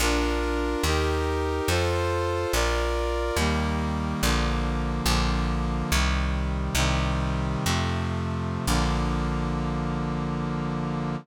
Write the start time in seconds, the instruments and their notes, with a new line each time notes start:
0.00 electric bass (finger) A#1, brass section D4 F4 A#4
0.83 electric bass (finger) D#2, brass section D#4 G4 A#4
1.68 electric bass (finger) F2, brass section F4 A4 C5
2.53 electric bass (finger) A#1, brass section F4 A#4 D5
3.36 electric bass (finger) D#2, brass section D#3 G3 A#3
4.23 electric bass (finger) A#1, brass section D3 F3 A#3
5.06 electric bass (finger) A#1, brass section D3 F3 A#3
5.91 electric bass (finger) C2, brass section C3 D#3 G3
6.75 electric bass (finger) C2, brass section C3 D#3 G3
7.66 electric bass (finger) F2, brass section C3 F3 A3
8.67 electric bass (finger) A#1, brass section D3 F3 A#3